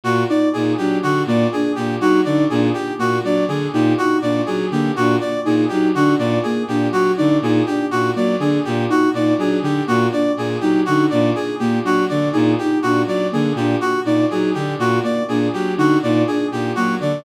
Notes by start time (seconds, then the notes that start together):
0.04 A#2 F#4
0.29 D#4 D5
0.53 A#2 D#4 G#4
0.77 F#3 D4 G4
1.03 D3 F#4
1.26 A#2 A#3 D5
1.52 D4 G#4
1.75 A#2 G4
2.00 F#3 D#4 F#4
2.25 D3 D#4 D5
2.50 A#2 D4 G#4
2.74 G4
2.98 A#2 A#3 F#4
3.23 F#3 D4 D5
3.48 D3 G#4
3.73 A#2 D#4 G4
3.98 D#4 F#4
4.21 A#2 D4 D5
4.46 F#3 G#4
4.70 D3 A#3 G4
4.96 A#2 D4 F#4
5.21 D5
5.45 A#2 D#4 G#4
5.69 F#3 D#4 G4
5.94 D3 D4 F#4
6.18 A#2 D5
6.43 A#3 G#4
6.68 A#2 D4 G4
6.91 F#3 F#4
7.18 D3 D#4 D5
7.41 A#2 D#4 G#4
7.66 D4 G4
7.91 A#2 F#4
8.16 F#3 A#3 D5
8.39 D3 D4 G#4
8.65 A#2 G4
8.90 D#4 F#4
9.13 A#2 D#4 D5
9.37 F#3 D4 G#4
9.61 D3 G4
9.87 A#2 A#3 F#4
10.12 D4 D5
10.37 A#2 G#4
10.61 F#3 D#4 G4
10.86 D3 D#4 F#4
11.10 A#2 D4 D5
11.35 G#4
11.59 A#2 A#3 G4
11.83 F#3 D4 F#4
12.09 D3 D5
12.33 A#2 D#4 G#4
12.58 D#4 G4
12.82 A#2 D4 F#4
13.06 F#3 D5
13.32 D3 A#3 G#4
13.55 A#2 D4 G4
13.81 F#4
14.05 A#2 D#4 D5
14.31 F#3 D#4 G#4
14.54 D3 D4 G4
14.79 A#2 F#4
15.04 A#3 D5
15.28 A#2 D4 G#4
15.53 F#3 G4
15.77 D3 D#4 F#4
16.02 A#2 D#4 D5
16.27 D4 G#4
16.52 A#2 G4
16.75 F#3 A#3 F#4
16.99 D3 D4 D5